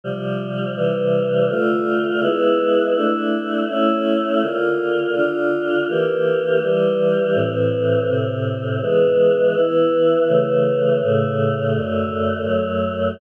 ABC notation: X:1
M:4/4
L:1/8
Q:1/4=82
K:Dm
V:1 name="Choir Aahs"
[C,F,G,]2 [C,E,G,]2 | [D,A,F]2 [^G,=B,E]2 [A,DE]2 [A,^CE]2 | [D,B,F]2 [D,DF]2 [E,B,G]2 [E,G,G]2 | [A,,E,C]2 [A,,C,C]2 [E,^G,=B,]2 [E,B,E]2 |
[^C,E,A,]2 [A,,C,A,]2 [^F,,D,A,]2 [F,,^F,A,]2 |]